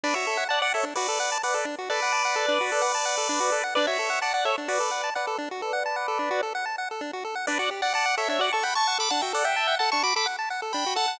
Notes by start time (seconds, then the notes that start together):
0.03 D4 B4 D5
0.14 F#4 C#5 E5
0.27 A4
0.37 F#5
0.49 D5 F#5 A5
0.62 D5 F#5
0.74 A4 C#5 E5
0.83 D4
0.95 F#4 B4 D5
1.08 A4
1.20 F#5
1.32 A5
1.43 B4 D5 F#5
1.54 A4
1.65 D4
1.78 F#4
1.90 A4 B4 D5
2.02 F#5
2.12 A5
2.25 F#5
2.36 A4
2.48 D4
2.61 F#4
2.72 A4
2.82 F#5
2.95 A5
3.05 F#5
3.18 A4
3.29 D4
3.40 F#4
3.52 A4
3.64 F#5
3.75 D4 B4 D5
3.87 F#4 C#5 E5
3.99 A4
4.10 F#5
4.22 D5 F#5 A5
4.34 D5 F#5
4.45 A4 C#5 E5
4.58 D4
4.68 F#4 B4 D5
4.80 A4
4.91 F#5
5.04 A5
5.15 B4 D5 F#5
5.27 A4
5.38 D4
5.51 F#4
5.61 A4 B4 D5
5.73 F#5
5.86 A5
5.96 F#5
6.08 A4
6.19 D4
6.31 F#4
6.43 A4
6.55 F#5
6.66 A5
6.78 F#5
6.91 A4
7.01 D4
7.13 F#4
7.25 A4
7.35 F#5
7.47 D4 B4 D5
7.59 F#4 D5 F#5
7.71 G4
7.82 D5 F#5
7.94 D5 F#5 A5
8.06 F#5
8.17 A4 C#5 E5
8.28 D4 C#5 E5
8.39 F#4 D5 F#5
8.52 A4 A5 C#6
8.63 F#5 G5 B5
8.75 A5 C#6
8.87 F#5
8.98 A4 B5 D6
9.10 D4 F#5 A5
9.22 F#4 E5 G5
9.33 A4 D5 F#5
9.44 E5 F#5 G5
9.56 A5
9.68 F#5
9.79 A4 F#5 A5
9.92 D4 A5 C#6
10.03 F#4 B5 D6
10.16 A4 B5 D6
10.26 F#5
10.39 A5
10.50 F#5
10.62 A4
10.73 D4 G5 B5
10.86 F#4
10.96 A4 F#5 A5
11.08 F#5